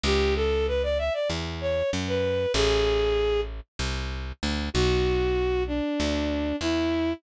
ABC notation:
X:1
M:4/4
L:1/16
Q:1/4=96
K:Bm
V:1 name="Violin"
G2 A2 B d e d z2 c2 z B3 | [M:7/8] ^G6 z8 | [M:4/4] F6 D6 E4 |]
V:2 name="Electric Bass (finger)" clef=bass
C,,8 E,,4 F,,4 | [M:7/8] A,,,8 =C,,4 D,,2 | [M:4/4] B,,,8 D,,4 E,,4 |]